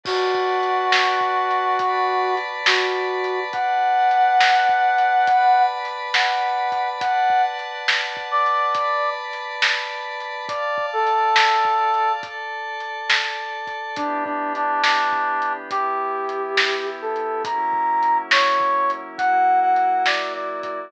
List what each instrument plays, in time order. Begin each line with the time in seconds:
0.04 brass section F#4, pad 5 (bowed) B4 D5 F#5 A5, kick, crash
0.35 kick
0.63 closed hi-hat
0.92 snare
1.21 kick
1.51 closed hi-hat
1.79 pad 5 (bowed) B4 D5 A5 B5, kick, closed hi-hat
2.37 closed hi-hat
2.66 brass section F#4, snare
3.24 closed hi-hat
3.53 pad 5 (bowed) B4 D5 F#5 A5, brass section F#5, kick, closed hi-hat
4.11 closed hi-hat
4.40 snare
4.69 kick
4.98 closed hi-hat
5.27 pad 5 (bowed) B4 D5 A5 B5, kick, closed hi-hat
5.85 closed hi-hat
6.14 brass section F#5, snare
6.72 kick, closed hi-hat
7.00 pad 5 (bowed) B4 D5 F#5 A5, brass section F#5, kick, closed hi-hat
7.30 kick
7.59 closed hi-hat
7.88 snare
8.17 kick
8.31 brass section D5
8.46 closed hi-hat
8.74 pad 5 (bowed) B4 D5 A5 B5, kick, closed hi-hat
9.33 closed hi-hat
9.62 snare
10.20 closed hi-hat
10.48 brass section D5, pad 5 (bowed) D5 F5 A5, kick, closed hi-hat
10.78 kick
10.93 brass section A4
11.07 closed hi-hat
11.36 snare
11.65 kick
11.94 closed hi-hat
12.23 pad 5 (bowed) A4 D5 A5, kick, closed hi-hat
12.80 closed hi-hat
13.10 snare
13.67 kick, closed hi-hat
13.96 pad 5 (bowed) E3 B3 D4 G4, brass section D4, kick, closed hi-hat
14.25 brass section D4, kick
14.55 brass section D4, closed hi-hat
14.83 brass section D4, snare
15.12 kick
15.42 closed hi-hat
15.70 pad 5 (bowed) E3 B3 E4 G4, brass section G4, kick, closed hi-hat
16.29 closed hi-hat
16.57 snare
17.02 brass section A4
17.16 closed hi-hat
17.45 pad 5 (bowed) F#3 A#3 C#4 E4, brass section A#5, kick, closed hi-hat
17.73 kick
18.03 closed hi-hat
18.31 brass section C#5, snare
18.61 kick
18.90 closed hi-hat
19.18 pad 5 (bowed) F#3 A#3 E4 F#4, brass section F#5, kick, closed hi-hat
19.62 brass section F#5
19.76 closed hi-hat
20.06 brass section D5, snare
20.35 brass section D5
20.63 brass section D5, kick, closed hi-hat